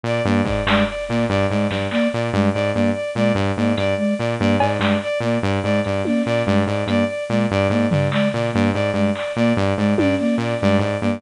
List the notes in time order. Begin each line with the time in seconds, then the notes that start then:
0.03 A#2 D5
0.25 G2 A#3 D5
0.44 G#2 D5, kick
0.66 G2 G#3 D5, clap
0.88 D5
1.08 A#2 A#3 D5
1.29 G2 D5
1.50 G#2 G#3 D5
1.70 G2 D5, snare
1.91 A#3 D5, clap
2.13 A#2 D5
2.32 G2 G#3 D5
2.53 G#2 D5
2.74 G2 A#3 D5
2.94 D5
3.15 A#2 G#3 D5
3.35 G2 D5
3.56 G#2 A#3 D5
3.77 G2 D5, closed hi-hat
3.97 G#3 D5
4.18 A#2 D5
4.39 G2 A#3 D5
4.60 G#2 D5, cowbell
4.79 G2 G#3 D5, clap
5.02 D5
5.20 A#2 A#3 D5
5.42 G2 D5
5.63 G#2 G#3 D5
5.84 G2 D5, closed hi-hat
6.05 A#3 D5, high tom
6.25 A#2 D5
6.46 G2 G#3 D5
6.67 G#2 D5
6.87 G2 A#3 D5, closed hi-hat
7.07 D5
7.29 A#2 G#3 D5
7.51 G2 D5
7.69 G#2 A#3 D5
7.90 G2 D5, floor tom
8.11 G#3 D5, clap
8.33 A#2 D5
8.53 G2 A#3 D5
8.73 G#2 D5
8.93 G2 G#3 D5
9.15 D5, clap
9.36 A#2 A#3 D5
9.57 G2 D5
9.77 G#2 G#3 D5
9.98 G2 D5, high tom
10.18 A#3 D5
10.38 A#2 D5
10.60 G2 G#3 D5
10.79 G#2 D5
11.01 G2 A#3 D5